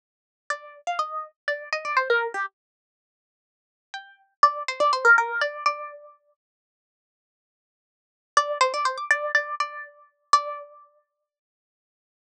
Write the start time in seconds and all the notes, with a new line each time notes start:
0.50 D5
0.87 F5
0.99 D#5
1.47 D5
1.72 D#5
1.85 D5
1.96 C5
2.10 A#4
2.34 G4
3.94 G5
4.43 D5
4.68 C5
4.80 D5
4.93 C5
5.04 A#4
5.18 A#4
5.41 D5
5.66 D5
8.37 D5
8.61 C5
8.73 D5
8.85 C5
8.97 D6
9.10 D5
9.34 D5
9.60 D5
10.33 D5